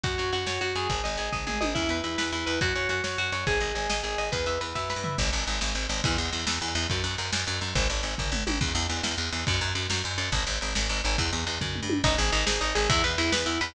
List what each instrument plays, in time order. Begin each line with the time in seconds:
0.04 electric bass (finger) F#2, overdriven guitar F#4, kick, ride
0.18 electric bass (finger) F#2, overdriven guitar C#5, ride
0.32 electric bass (finger) F#2, overdriven guitar F#4, ride
0.46 electric bass (finger) F#2, overdriven guitar C#5, snare
0.61 electric bass (finger) F#2, overdriven guitar F#4, ride
0.75 electric bass (finger) F#2, overdriven guitar G#4, ride
0.90 electric bass (finger) G#1, kick, ride
1.04 electric bass (finger) G#1, overdriven guitar D#5, ride
1.17 electric bass (finger) G#1, overdriven guitar G#4, ride
1.32 electric bass (finger) G#1, overdriven guitar D#5, kick, floor tom
1.47 electric bass (finger) G#1, overdriven guitar G#4, mid tom
1.61 electric bass (finger) G#1, overdriven guitar D#5, high tom
1.75 electric bass (finger) E2, overdriven guitar E4, kick, crash
1.89 electric bass (finger) E2, overdriven guitar B4, ride
2.04 electric bass (finger) E2, overdriven guitar E4, ride
2.18 electric bass (finger) E2, overdriven guitar B4, snare
2.32 electric bass (finger) E2, overdriven guitar E4, ride
2.46 electric bass (finger) E2, overdriven guitar B4, ride
2.61 electric bass (finger) F#2, overdriven guitar F#4, kick, ride
2.75 electric bass (finger) F#2, overdriven guitar C#5, ride
2.89 electric bass (finger) F#2, overdriven guitar F#4, ride
3.04 electric bass (finger) F#2, overdriven guitar C#5, snare
3.18 electric bass (finger) F#2, overdriven guitar F#4, ride
3.32 electric bass (finger) F#2, overdriven guitar C#5, ride
3.47 electric bass (finger) G#1, overdriven guitar G#4, kick, ride
3.60 electric bass (finger) G#1, overdriven guitar D#5, ride
3.75 electric bass (finger) G#1, overdriven guitar G#4, ride
3.89 electric bass (finger) G#1, overdriven guitar D#5, snare
4.03 electric bass (finger) G#1, overdriven guitar G#4, ride
4.18 electric bass (finger) G#1, overdriven guitar D#5, ride
4.32 electric bass (finger) E2, overdriven guitar B4, kick, ride
4.46 electric bass (finger) E2, overdriven guitar E5, ride
4.61 electric bass (finger) E2, overdriven guitar B4, ride
4.75 electric bass (finger) F#2, overdriven guitar E5, kick, snare
4.90 overdriven guitar B4, snare
4.96 electric bass (finger) G2
5.04 overdriven guitar E5, floor tom
5.18 electric bass (finger) G#1, kick, crash
5.25 ride
5.32 electric bass (finger) G#1, ride
5.40 ride
5.47 electric bass (finger) G#1, ride
5.54 ride
5.61 electric bass (finger) G#1, snare
5.68 ride
5.75 electric bass (finger) G#1, ride
5.82 ride
5.89 electric bass (finger) G#1, ride
5.97 ride
6.04 electric bass (finger) E2, kick, ride
6.11 ride
6.18 electric bass (finger) E2, ride
6.25 ride
6.32 electric bass (finger) E2, ride
6.40 ride
6.47 electric bass (finger) E2, snare
6.54 ride
6.61 electric bass (finger) E2, ride
6.68 ride
6.75 electric bass (finger) E2, ride
6.82 ride
6.90 electric bass (finger) F#2, kick, ride
6.97 ride
7.04 electric bass (finger) F#2, ride
7.11 ride
7.18 electric bass (finger) F#2, ride
7.25 ride
7.32 electric bass (finger) F#2, snare
7.40 ride
7.47 electric bass (finger) F#2, ride
7.54 ride
7.61 electric bass (finger) F#2, ride
7.68 ride
7.75 electric bass (finger) G#1, kick, ride
7.82 ride
7.90 electric bass (finger) G#1, ride
7.97 ride
8.03 electric bass (finger) G#1, ride
8.11 ride
8.18 electric bass (finger) G#1, kick, floor tom
8.32 electric bass (finger) G#1, mid tom
8.47 electric bass (finger) G#1, high tom
8.61 electric bass (finger) E2, kick, crash
8.68 ride
8.75 electric bass (finger) E2, ride
8.82 ride
8.89 electric bass (finger) E2, ride
8.97 ride
9.03 electric bass (finger) E2, snare
9.11 ride
9.18 electric bass (finger) E2, ride
9.25 ride
9.32 electric bass (finger) E2, ride
9.40 ride
9.47 electric bass (finger) F#2, kick, ride
9.54 ride
9.61 electric bass (finger) F#2, ride
9.68 ride
9.75 electric bass (finger) F#2, ride
9.82 ride
9.90 electric bass (finger) F#2, snare
9.97 ride
10.04 electric bass (finger) F#2, ride
10.11 ride
10.18 electric bass (finger) F#2, ride
10.25 ride
10.32 electric bass (finger) G#1, kick, ride
10.40 ride
10.47 electric bass (finger) G#1, ride
10.54 ride
10.61 electric bass (finger) G#1, ride
10.68 ride
10.75 electric bass (finger) G#1, snare
10.82 ride
10.89 electric bass (finger) G#1, ride
10.97 ride
11.04 electric bass (finger) G#1, ride
11.11 ride
11.18 electric bass (finger) E2, kick, ride
11.25 ride
11.32 electric bass (finger) E2, ride
11.40 ride
11.47 electric bass (finger) E2, ride
11.54 ride
11.61 electric bass (finger) F#2, kick, floor tom
11.75 mid tom
11.82 electric bass (finger) G2
11.90 high tom
12.04 electric bass (finger) G#1, overdriven guitar D#4, kick, ride
12.18 electric bass (finger) G#1, overdriven guitar G#4, ride
12.32 electric bass (finger) G#1, overdriven guitar D#4, ride
12.46 electric bass (finger) G#1, overdriven guitar G#4, snare
12.61 electric bass (finger) G#1, overdriven guitar D#4, ride
12.75 electric bass (finger) G#1, overdriven guitar G#4, ride
12.89 electric bass (finger) E2, overdriven guitar E4, kick, ride
13.04 electric bass (finger) E2, overdriven guitar B4, ride
13.18 electric bass (finger) E2, overdriven guitar E4, ride
13.32 electric bass (finger) E2, overdriven guitar B4, snare
13.46 electric bass (finger) E2, overdriven guitar E4, ride
13.61 electric bass (finger) E2, overdriven guitar B4, ride